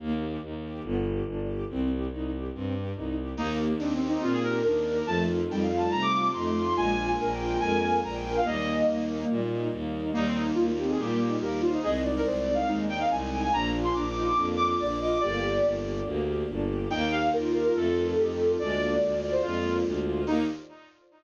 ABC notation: X:1
M:4/4
L:1/16
Q:1/4=142
K:Eb
V:1 name="Violin"
z16 | z16 | E z3 (3D2 C2 E2 F A B2 B4 | =a z3 (3g2 f2 a2 b d' d'2 c'4 |
(3a4 a4 g4 a2 a2 b g2 f | e6 z10 | E C E z F F G A G4 G2 F E | A z2 B (3c2 d2 f2 z2 g f a2 a a |
b z2 c' (3d'2 d'2 d'2 z2 d' d' d'2 d' d' | d6 z10 | g2 f2 B2 B B =A8 | d6 d c F4 z4 |
E4 z12 |]
V:2 name="Flute"
z16 | z16 | B,4 C8 D4 | F,4 G,8 =A,4 |
F4 B8 B4 | B,10 z6 | B,6 C2 B,4 B2 c2 | e2 d4 z2 E6 z2 |
D6 E2 D4 d2 e2 | G6 z10 | E4 F8 G4 | D4 z12 |
E4 z12 |]
V:3 name="String Ensemble 1"
B,2 G2 E2 G2 =B,2 G2 D2 G2 | C2 G2 E2 G2 C2 G2 E2 G2 | B,2 G2 E2 G2 B,2 G2 E2 G2 | =A,2 F2 E2 F2 A,2 F2 E2 F2 |
A,2 B,2 D2 F2 A,2 B,2 D2 F2 | G,2 E2 B,2 E2 G,2 E2 B,2 E2 | G,2 E2 B,2 E2 G,2 E2 B,2 E2 | A,2 E2 C2 E2 A,2 E2 C2 E2 |
B,2 F2 D2 F2 B,2 F2 D2 F2 | B,2 G2 D2 G2 B,2 G2 D2 G2 | B,2 G2 E2 G2 =A,2 F2 E2 F2 | A,2 B,2 D2 F2 A,2 B,2 D2 F2 |
[B,EG]4 z12 |]
V:4 name="Violin" clef=bass
E,,4 E,,4 G,,,4 G,,,4 | C,,4 C,,4 G,,4 C,,4 | E,,4 E,,4 B,,4 E,,4 | F,,4 F,,4 C,4 F,,4 |
B,,,4 B,,,4 F,,4 B,,,4 | E,,4 E,,4 B,,4 E,,4 | E,,4 E,,4 B,,4 E,,4 | C,,4 C,,4 E,,4 C,,4 |
B,,,4 B,,,4 F,,4 B,,,4 | G,,,4 G,,,4 D,,4 G,,,4 | E,,4 E,,4 F,,4 F,,4 | D,,4 D,,4 F,,4 D,,4 |
E,,4 z12 |]
V:5 name="String Ensemble 1"
z16 | z16 | [B,EG]16 | [=A,CEF]16 |
[A,B,DF]16 | [G,B,E]16 | [G,B,E]16 | [A,CE]16 |
[B,DF]16 | [B,DG]16 | [B,EG]8 [=A,CEF]8 | [A,B,DF]16 |
[B,EG]4 z12 |]